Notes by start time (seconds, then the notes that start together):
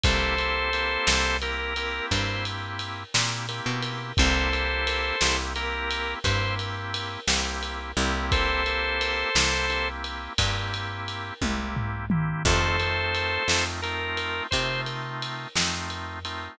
0.03 C2 A#3 C4 E4 G4 A4 C5, kick, ride
0.38 A#3 C4 E4 G4, ride
0.73 A#3 C4 E4 G4, ride
1.07 C2, snare
1.42 A#3 C4 E4 G4 A#4, ride
1.76 A#3 C4 E4 G4, ride
2.11 G2 C5, kick, ride
2.45 ride
2.79 ride
3.14 A#2 A#3 C4 E4 G4, snare
3.49 A#3 C4 E4 G4, ride
3.66 B2
3.82 ride
4.17 C2 A#3 C4 E4 G4 A4 C5, kick, ride
4.52 A#3 C4 E4 G4, ride
4.87 ride
5.21 C2 A#3 C4 E4 G4, snare
5.56 A#3 C4 E4 G4 A#4, ride
5.91 ride
6.24 G2 A#3 C4 E4 G4 C5, kick, ride
6.59 ride
6.94 ride
7.27 C2 A#3 C4 E4 G4, snare
7.63 ride
7.97 C2 A#3 C4 E4 G4, ride
8.32 A4 C5, kick, ride
8.66 A#3 C4 E4 G4, ride
9.01 ride
9.35 C2 A#3 C4 E4 G4, snare
9.70 A#3 C4 E4 G4, ride
10.04 ride
10.38 G2 A#3 C4 E4 G4, kick, ride
10.74 ride
11.08 ride
11.42 C2 A#3 C4 E4 G4, kick, high tom
11.76 floor tom
12.10 A#3 C4 E4 G4, mid tom
12.45 F2 A3 C4 D#4 F4 A4 C5, kick, crash
12.80 A3 C4 D#4 F4, ride
13.15 ride
13.48 F2 A3 C4 D#4 F4, snare
13.82 A3 C4 D#4 F4 A#4, ride
14.17 ride
14.51 C3 A3 C4 D#4 F4 C5, kick, ride
14.86 ride
15.22 ride
15.55 F2 A3 C4 D#4 F4, snare
15.90 ride
16.25 A3 C4 D#4 F4, ride